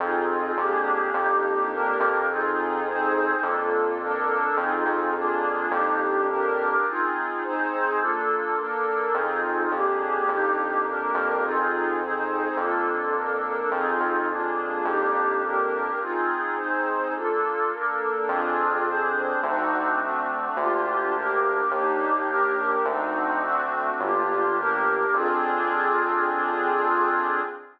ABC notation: X:1
M:4/4
L:1/8
Q:1/4=105
K:Fdor
V:1 name="Pad 2 (warm)"
[CEFA]2 [B,DGA]2 [B,DEG]2 [B,DGB]2 | [CEFA]2 [CEAc]2 [B,DF=A]2 [B,DAB]2 | [CEFA]2 [B,DFA]2 [B,DEG]2 [B,DGB]2 | [CEFA]2 [CEAc]2 [B,DF=A]2 [B,DAB]2 |
[CEFA]2 [B,DGA]2 [B,DEG]2 [B,DGB]2 | [CEFA]2 [CEAc]2 [B,DF=A]2 [B,DAB]2 | [CEFA]2 [B,DFA]2 [B,DEG]2 [B,DGB]2 | [CEFA]2 [CEAc]2 [B,DF=A]2 [B,DAB]2 |
[CDFA]2 [CDAc]2 [CDE^F]2 [=A,CDF]2 | [B,DFG]2 [B,DGB]2 [B,DEG]2 [B,DGB]2 | [CDE^F]2 [=A,CDF]2 [B,D=FG]2 [B,DGB]2 | [CDFA]8 |]
V:2 name="Synth Bass 1" clef=bass
F,,2 F,,2 F,,3 F,,- | F,,4 F,,4 | F,, F,,3 F,,4 | z8 |
F,,2 F,,2 F,,3 F,,- | F,,4 F,,4 | F,, F,,3 F,,4 | z8 |
F,,4 D,,4 | D,,4 E,,4 | D,,4 G,,,4 | F,,8 |]